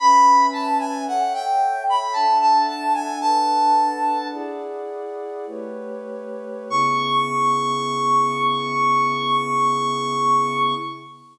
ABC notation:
X:1
M:3/4
L:1/16
Q:1/4=56
K:C#phr
V:1 name="Brass Section"
b2 a g f =g2 b a a a ^g | "^rit." a4 z8 | c'12 |]
V:2 name="Pad 2 (warm)"
[CBeg]4 [Ace=g]4 [DAef]4 | "^rit." [DABf]4 [EGdf]4 [A,=GBc]4 | [C,B,EG]12 |]